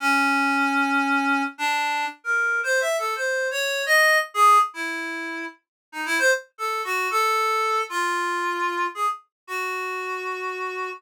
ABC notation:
X:1
M:3/4
L:1/16
Q:1/4=114
K:none
V:1 name="Clarinet"
^C12 | D4 z ^A3 (3c2 e2 =A2 | (3c4 ^c4 ^d4 z ^G2 z | E6 z3 ^D E c |
z2 A2 ^F2 A6 | F8 ^G z3 | ^F12 |]